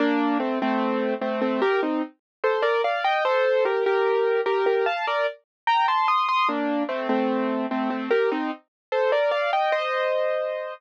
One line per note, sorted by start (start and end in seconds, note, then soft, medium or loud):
0.00 0.38 A#3 medium
0.00 0.38 D4 medium
0.40 0.59 A3 medium
0.40 0.59 C4 medium
0.62 1.14 A3 medium
0.62 1.14 C4 medium
1.21 1.41 A3 medium
1.21 1.41 C4 medium
1.42 1.61 A3 medium
1.42 1.61 C4 medium
1.62 1.81 G4 medium
1.62 1.81 A#4 medium
1.83 2.02 C4 medium
1.83 2.02 D#4 medium
2.44 2.63 A4 medium
2.44 2.63 C5 medium
2.63 2.82 A#4 medium
2.63 2.82 D5 medium
2.84 3.04 D5 medium
2.84 3.04 F5 medium
3.04 3.24 D#5 medium
3.04 3.24 G5 medium
3.25 3.64 A4 medium
3.25 3.64 C5 medium
3.65 3.84 G4 medium
3.65 3.84 A#4 medium
3.86 4.41 G4 medium
3.86 4.41 A#4 medium
4.46 4.65 G4 medium
4.46 4.65 A#4 medium
4.66 4.85 G4 medium
4.66 4.85 A#4 medium
4.86 5.05 F5 medium
4.86 5.05 A5 medium
5.07 5.27 A#4 medium
5.07 5.27 D5 medium
5.67 5.86 G5 medium
5.67 5.86 A#5 medium
5.88 6.07 A5 medium
5.88 6.07 C6 medium
6.08 6.27 C6 medium
6.08 6.27 D#6 medium
6.29 6.48 C6 medium
6.29 6.48 D#6 medium
6.48 6.83 A#3 medium
6.48 6.83 D4 medium
6.89 7.08 A3 medium
6.89 7.08 C4 medium
7.09 7.66 A3 medium
7.09 7.66 C4 medium
7.71 7.90 A3 medium
7.71 7.90 C4 medium
7.90 8.10 A3 medium
7.90 8.10 C4 medium
8.10 8.30 G4 medium
8.10 8.30 A#4 medium
8.32 8.51 C4 medium
8.32 8.51 D#4 medium
8.92 9.11 A4 medium
8.92 9.11 C5 medium
9.12 9.31 A#4 medium
9.12 9.31 D5 medium
9.31 9.51 D5 medium
9.31 9.51 F5 medium
9.53 9.72 D#5 medium
9.53 9.72 G5 medium
9.72 10.73 C5 medium
9.72 10.73 D#5 medium